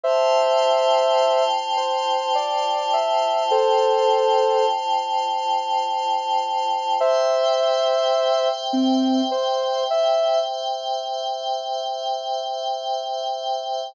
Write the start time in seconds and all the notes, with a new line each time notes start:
0.03 F4 C5 E5 G5 A5
1.77 C5
2.35 D5
2.93 E5
3.51 A4 C5
6.99 C5 E5 G5
8.73 C4
9.31 C5
9.90 E5